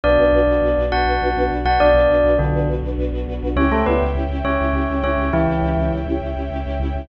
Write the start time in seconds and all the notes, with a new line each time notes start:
0.03 B1 B3 D4 F#4 B4 D5
0.18 B1 D4 F#4 B4
0.32 B1 D4 F#4 B4
0.47 B1 D4 F#4 B4
0.61 B1 D4 F#4 B4
0.77 B1 D4 F#4 B4
0.92 B1 D4 F#4 B4 F#5
1.05 B1 D4 F#4 B4
1.21 B1 D4 F#4 B4
1.36 B1 D4 F#4 B4
1.51 B1 D4 F#4 B4
1.65 B1 D4 F#4 B4 F#5
1.80 B1 D4 F#4 B4 D5
1.94 B1 D4 F#4 B4
2.09 B1 D4 F#4 B4
2.24 B1 D4 F#4 B4
2.39 B1 D3 D4 F#4 B4
2.53 B1 D4 F#4 B4
2.68 B1 D4 F#4 B4
2.83 B1 D4 F#4 B4
2.98 B1 D4 F#4 B4
3.12 B1 D4 F#4 B4
3.27 B1 D4 F#4 B4
3.42 B1 D4 F#4 B4
3.56 C#2 C#4 E4 G4 C#5 E5 G5
3.70 C#2 A3 C#4 E4 G4 A4
3.86 C#2 B3 C#4 E4 G4 B4
4.01 C#2 C#4 E4 G4
4.15 C#2 C#4 E4 G4
4.29 C#2 C#4 E4 G4
4.44 C#2 C#4 E4 G4 C#5
4.59 C#2 C#4 E4 G4
4.73 C#2 C#4 E4 G4
4.89 C#2 C#4 E4 G4
5.03 C#2 C#4 E4 G4 C#5
5.17 C#2 C#4 E4 G4
5.33 C#2 E3 C#4 E4 G4
5.48 C#2 C#4 E4 G4
5.62 C#2 C#4 E4 G4
5.77 C#2 C#4 E4 G4
5.92 C#2 C#4 E4 G4
6.06 C#2 C#4 E4 G4
6.21 C#2 C#4 E4 G4
6.36 C#2 C#4 E4 G4
6.51 C#2 C#4 E4 G4
6.66 C#2 C#4 E4 G4
6.80 C#2 C#4 E4 G4
6.95 C#2 C#4 E4 G4